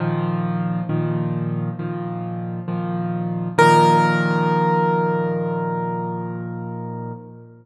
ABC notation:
X:1
M:4/4
L:1/8
Q:1/4=67
K:Bb
V:1 name="Acoustic Grand Piano"
z8 | B8 |]
V:2 name="Acoustic Grand Piano" clef=bass
[B,,E,F,]2 [B,,E,F,]2 [B,,E,F,]2 [B,,E,F,]2 | [B,,E,F,]8 |]